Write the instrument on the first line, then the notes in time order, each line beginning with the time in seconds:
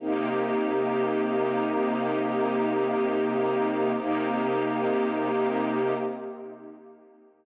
string ensemble 1
0.00 C3 A#3 D#4 G4
3.97 C3 A#3 D#4 G4